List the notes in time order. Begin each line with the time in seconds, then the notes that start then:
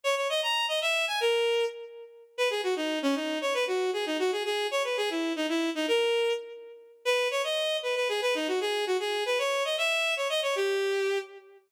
0.04 C#5
0.17 C#5
0.29 D#5
0.43 A#5
0.68 D#5
0.81 E5
1.07 G#5
1.20 A#4
2.37 B4
2.50 G#4
2.63 F#4
2.76 D#4
3.02 C#4
3.15 D#4
3.41 C#5
3.54 B4
3.67 F#4
3.93 G#4
4.06 D#4
4.19 F#4
4.32 G#4
4.45 G#4
4.71 C#5
4.84 B4
4.97 G#4
5.10 E4
5.36 D#4
5.49 E4
5.75 D#4
5.88 A#4
7.05 B4
7.31 C#5
7.44 D#5
7.83 B4
7.96 B4
8.09 G#4
8.22 B4
8.35 D#4
8.48 F#4
8.61 G#4
8.87 F#4
9.00 G#4
9.26 B4
9.39 C#5
9.65 D#5
9.78 E5
10.17 C#5
10.29 D#5
10.43 C#5
10.56 G4